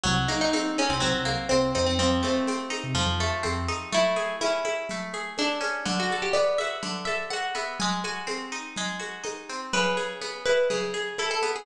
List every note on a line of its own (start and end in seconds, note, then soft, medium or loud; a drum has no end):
0.04 0.27 C2 medium
0.04 1.00 F#3 loud
0.04 low conga loud
0.04 shaker medium
0.28 1.25 A#3 medium
0.28 0.40 D#4 medium
0.28 high conga medium
0.28 shaker medium
0.41 0.53 D#4 medium
0.53 1.51 C4 medium
0.53 0.76 D#4 medium
0.53 high conga medium
0.53 shaker medium
0.78 0.90 C#4 medium
0.78 1.74 D#4 medium
0.78 high conga medium
0.78 shaker medium
0.89 1.00 C2 medium
0.89 1.01 C4 medium
1.00 1.13 C2 medium
1.00 1.92 F#3 medium
1.00 1.47 C4 medium
1.00 low conga medium
1.00 shaker medium
1.14 1.36 C2 medium
1.25 1.94 A#3 medium
1.25 high conga medium
1.25 shaker medium
1.49 1.73 C2 medium
1.49 1.72 C4 medium
1.49 1.97 C4 medium
1.49 high conga medium
1.49 shaker medium
1.75 2.22 F2 medium
1.75 1.86 C4 medium
1.75 1.98 D#4 medium
1.75 shaker medium
1.86 1.98 C4 medium
1.99 2.94 F3 medium
1.99 2.22 C4 medium
1.99 low conga medium
1.99 shaker medium
2.23 3.20 A3 medium
2.23 3.16 C4 medium
2.23 high conga medium
2.23 shaker medium
2.47 3.43 C4 medium
2.47 high conga medium
2.47 shaker medium
2.70 3.68 D#4 medium
2.70 high conga medium
2.70 shaker medium
2.84 2.95 C3 medium
2.94 3.05 F2 medium
2.94 3.87 F3 medium
2.94 low conga medium
2.94 shaker medium
3.06 3.28 F2 medium
3.20 3.89 A3 medium
3.20 high conga medium
3.20 shaker medium
3.43 3.67 F2 medium
3.43 3.89 C4 medium
3.43 high conga medium
3.43 shaker medium
3.68 3.91 D#4 medium
3.68 high conga medium
3.68 shaker medium
3.92 4.90 A3 medium
3.92 4.36 E4 loud
3.92 low conga medium
3.92 shaker medium
4.16 5.13 G#4 medium
4.16 high conga medium
4.16 shaker medium
4.41 5.60 C#4 medium
4.41 5.27 E4 medium
4.41 high conga medium
4.41 shaker medium
4.65 5.38 E4 medium
4.65 high conga medium
4.65 shaker medium
4.89 5.83 A3 medium
4.89 low conga medium
4.89 shaker medium
5.14 5.83 G#4 medium
5.14 high conga medium
5.14 shaker medium
5.38 5.82 D4 medium
5.38 5.85 E4 medium
5.38 high conga medium
5.38 shaker medium
5.61 5.84 C#4 medium
5.61 high conga medium
5.61 shaker medium
5.85 6.82 D3 medium
5.85 low conga loud
5.85 shaker medium
6.00 6.21 F#4 medium
6.10 7.07 A4 medium
6.10 high conga medium
6.10 shaker medium
6.22 6.34 G4 medium
6.33 7.54 B3 medium
6.33 6.56 D5 medium
6.33 high conga medium
6.33 shaker medium
6.58 7.33 F#4 medium
6.58 7.04 E5 medium
6.58 high conga medium
6.58 shaker medium
6.83 7.75 D3 medium
6.83 low conga medium
6.83 shaker medium
7.05 7.76 A4 medium
7.05 7.26 E5 medium
7.05 high conga medium
7.05 shaker medium
7.30 7.79 F#4 medium
7.30 7.51 F#5 medium
7.30 high conga medium
7.30 shaker medium
7.55 7.78 B3 medium
7.55 7.77 E5 medium
7.55 high conga medium
7.55 shaker medium
7.80 8.77 G#3 medium
7.80 7.99 G#5 loud
7.80 low conga loud
7.80 shaker medium
8.04 8.99 F#4 medium
8.04 9.14 G#5 medium
8.04 high conga medium
8.04 shaker medium
8.27 9.49 C4 medium
8.27 high conga medium
8.27 shaker medium
8.52 9.23 D#4 medium
8.52 shaker medium
8.76 9.69 G#3 medium
8.76 low conga medium
8.76 shaker medium
8.99 9.68 F#4 medium
8.99 high conga medium
8.99 shaker medium
9.24 9.70 D#4 medium
9.24 high conga medium
9.24 shaker medium
9.49 9.72 C4 medium
9.49 shaker medium
9.73 10.70 C#3 medium
9.73 10.07 B4 loud
9.73 low conga medium
9.73 shaker medium
9.97 10.93 G#4 medium
9.97 high conga medium
9.97 shaker medium
10.21 11.42 B3 medium
10.21 high conga medium
10.21 shaker medium
10.45 11.18 E4 medium
10.45 10.68 B4 medium
10.45 high conga medium
10.45 shaker medium
10.70 11.63 C#3 medium
10.70 11.15 G#4 medium
10.70 low conga medium
10.70 shaker medium
10.94 11.63 G#4 medium
10.94 high conga medium
10.94 shaker medium
11.18 11.65 E4 medium
11.18 11.30 A4 medium
11.18 high conga medium
11.18 shaker medium
11.31 11.51 A4 medium
11.43 11.66 B3 medium
11.43 high conga medium
11.43 shaker medium
11.56 11.66 G#4 medium